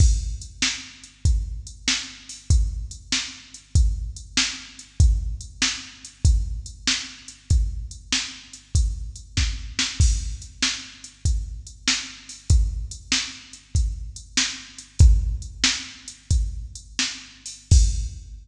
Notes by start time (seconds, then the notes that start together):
0.00 kick, crash
0.42 closed hi-hat
0.62 snare
1.04 closed hi-hat
1.25 kick, closed hi-hat
1.67 closed hi-hat
1.88 snare
2.29 open hi-hat
2.50 kick, closed hi-hat
2.91 closed hi-hat
3.12 snare
3.54 closed hi-hat
3.75 kick, closed hi-hat
4.16 closed hi-hat
4.37 snare
4.79 closed hi-hat
5.00 kick, closed hi-hat
5.41 closed hi-hat
5.62 snare
6.05 closed hi-hat
6.25 kick, closed hi-hat
6.66 closed hi-hat
6.87 snare
7.28 closed hi-hat
7.50 kick, closed hi-hat
7.91 closed hi-hat
8.12 snare
8.53 closed hi-hat
8.75 kick, closed hi-hat
9.16 closed hi-hat
9.37 kick, snare
9.79 snare
10.00 kick, crash
10.42 closed hi-hat
10.62 snare
11.04 closed hi-hat
11.25 kick, closed hi-hat
11.67 closed hi-hat
11.88 snare
12.29 open hi-hat
12.50 kick, closed hi-hat
12.91 closed hi-hat
13.12 snare
13.53 closed hi-hat
13.75 kick, closed hi-hat
14.16 closed hi-hat
14.37 snare
14.78 closed hi-hat
14.99 kick, closed hi-hat
15.42 closed hi-hat
15.64 snare
16.08 closed hi-hat
16.31 kick, closed hi-hat
16.75 closed hi-hat
16.99 snare
17.46 open hi-hat
17.71 kick, crash